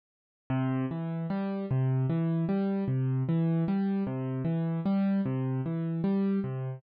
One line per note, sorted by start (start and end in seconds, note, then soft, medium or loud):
0.50 0.86 C3 medium
0.91 1.26 E3 medium
1.30 1.66 G3 medium
1.71 2.06 C3 medium
2.10 2.45 E3 medium
2.49 2.84 G3 medium
2.88 3.23 C3 medium
3.29 3.64 E3 medium
3.68 4.04 G3 medium
4.07 4.42 C3 medium
4.45 4.80 E3 medium
4.86 5.21 G3 medium
5.25 5.61 C3 medium
5.66 6.01 E3 medium
6.04 6.39 G3 medium
6.44 6.79 C3 medium